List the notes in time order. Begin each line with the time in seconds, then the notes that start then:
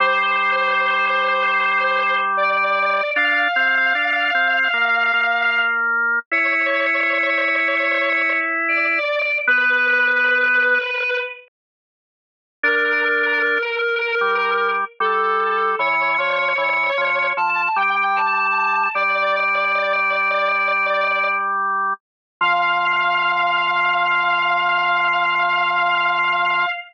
0.00 G3 C5
2.37 D5
3.16 D4 F5
3.56 C4
3.95 D4
4.34 C4
4.73 A#3
5.13 A#3
6.31 E4 C#5
8.68 D5
9.47 B3 B4
12.63 D4 A#4
14.21 G3
15.00 G3 A4
15.79 E3 C#5
16.18 F3
16.58 E3
16.97 F3
17.37 F3 A5
17.76 G3 G5
18.16 A5
18.94 G3 D5
22.41 F3 F5